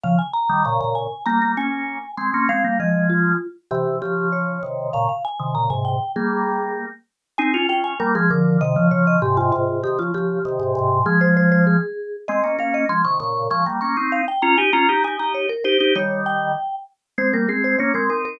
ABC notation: X:1
M:2/2
L:1/8
Q:1/2=98
K:Fm
V:1 name="Vibraphone"
f a b2 b b a2 | b2 a4 c'2 | f2 e2 F3 z | G2 G2 d4 |
f f a2 b a g2 | A5 z3 | [K:Ab] a2 g a B A B2 | e2 d e G F F2 |
G F G6 | A c c c A4 | e2 f e c' d' d'2 | d' z d'2 f g b a |
b2 a b d B c2 | d2 g4 z2 | [K:Fm] c B A c d B B B |]
V:2 name="Drawbar Organ"
[D,F,] z2 [E,G,] [B,,D,] [B,,D,]2 z | [G,B,] [G,B,] [B,D]3 z [A,C] [B,D] | [A,C] [G,B,] [F,A,]4 z2 | [C,=E,]2 [D,F,]4 [C,_E,]2 |
[B,,D,] z2 [C,E,] [B,,D,] [A,,C,]2 z | [G,B,]5 z3 | [K:Ab] [CE] [DF] [DF]2 [G,B,] [F,A,] [=D,F,]2 | [C,E,] [D,F,] [D,F,]2 [A,,C,] [A,,C,] [A,,C,]2 |
[C,E,] [D,F,] [D,F,]2 [C,E,] [A,,C,] [A,,C,]2 | [F,A,]5 z3 | [A,C] [B,D] [B,D]2 [F,A,] [C,E,] [B,,D,]2 | [F,A,] [G,B,] [B,D] [CE]2 z [DF] [EG] |
[DF] [EG] [EG] [EG]2 z [EG] [EG] | [E,G,]4 z4 | [K:Fm] [A,C] [G,B,] [A,C]2 [B,D] [A,C] [CE]2 |]